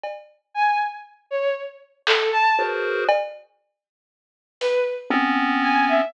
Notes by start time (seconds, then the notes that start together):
0.04 cowbell
0.54 G#5
1.31 C#5
2.07 A4, clap
2.33 A5
2.59 F#4 G#4 A#4 B4 C5
3.09 cowbell
4.61 B4, closed hi-hat
5.10 B3 C4 C#4
5.63 G#5
5.89 E5